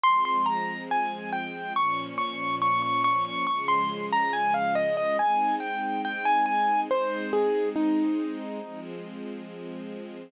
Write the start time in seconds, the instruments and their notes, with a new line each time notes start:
0.03 string ensemble 1 F3 G#3 C4, acoustic grand piano C6
0.25 acoustic grand piano C6
0.46 acoustic grand piano A#5
0.91 acoustic grand piano G#5
1.33 acoustic grand piano G5
1.76 string ensemble 1 A#2 F3 C#4, acoustic grand piano C#6
2.18 acoustic grand piano C#6
2.62 acoustic grand piano C#6
2.82 acoustic grand piano C#6
3.04 acoustic grand piano C#6
3.25 acoustic grand piano C#6
3.47 string ensemble 1 C#3 F3 G#3, acoustic grand piano C#6
3.68 acoustic grand piano C6
4.13 acoustic grand piano A#5
4.33 acoustic grand piano G#5
4.54 acoustic grand piano F5
4.75 acoustic grand piano D#5
4.97 acoustic grand piano D#5
5.19 string ensemble 1 G#3 C4 D#4, acoustic grand piano G#5
5.60 acoustic grand piano G5
6.05 acoustic grand piano G5
6.25 acoustic grand piano G#5
6.46 acoustic grand piano G#5
6.90 string ensemble 1 G#3 C4 D#4, acoustic grand piano C5
7.33 acoustic grand piano G#4
7.76 acoustic grand piano D#4
8.61 string ensemble 1 F3 G#3 C4